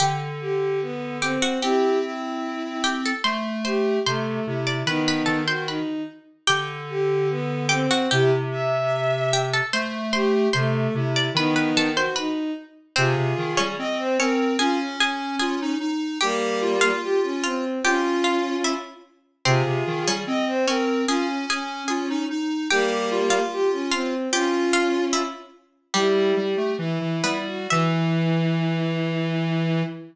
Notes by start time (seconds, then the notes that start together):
0.00 D3 G4 G5
0.40 G4
0.82 B3
1.21 C4 G4 G5
1.42 F#4 F#5
1.62 C4 E4 G4 G5
2.02 E4
2.84 G4 G5
3.05 A4 A5
3.24 A3 C5 C6
3.65 G4 C5 C6
4.06 C3 A3 C5 C6
4.46 C3 E4
4.67 D5 D6
4.86 D#3 B3 D#4 B4 B5
5.08 B4 B5
5.26 D#3 A4 A5
5.47 F#4 C5 C6
5.67 D#4 B4 B5
6.47 D3 G4 G5
6.89 G4
7.30 B3
7.69 C4 G4 G5
7.91 F#4 F#5
8.11 C3 E4 G4 G5
8.52 E5
9.33 G4 G5
9.53 A4 A5
9.73 A3 C5 C6
10.13 G4 C5 C6
10.53 C3 A3 C5 C6
10.94 C3 E4
11.16 D5 D6
11.34 D#3 B3 D#4 B4 B5
11.56 B4 B5
11.76 D#3 A4 A5
11.96 F#4 C5 C6
12.16 D#4 B4 B5
12.96 C3 C4 F4 G#4 C5
13.17 C3
13.38 D#3
13.57 G3 C#4 C#5
13.78 C4 D#5
13.99 C5
14.18 C4 C#4 A#4 C#5
14.59 C#4 F4 G#4 G#5
14.80 C#4
15.00 C#4 G#4 G#5
15.39 F4 G#4 G#5
15.61 D#4
15.80 D#4
16.21 G3 A#3 G4 G5
16.62 F4
16.81 F4 F5
17.02 G4
17.23 C#4
17.43 C4 F4 F5
17.84 C#4 F4 G4 G5
18.24 F4 F5
18.64 E4 E5
19.45 C3 C4 F4 G#4 C5
19.66 C3
19.87 D#3
20.07 G3 C#4 C#5
20.27 C4 D#5
20.47 C5
20.67 C4 C#4 A#4 C#5
21.08 C#4 F4 G#4 G#5
21.29 C#4
21.49 C#4 G#4 G#5
21.88 F4 G#4 G#5
22.10 D#4
22.30 D#4
22.70 G3 A#3 G4 G5
23.11 F4
23.30 F4 F5
23.51 G4
23.72 C#4
23.91 C4 F4 F5
24.32 C#4 F4 G4 G5
24.73 F4 F5
25.13 E4 E5
25.94 G3 E4 G4
26.36 G3 G4
26.57 A3
26.78 E3 E4
27.01 E3
27.24 G3 B3 B4
27.47 F#4
27.70 E3 E4 E5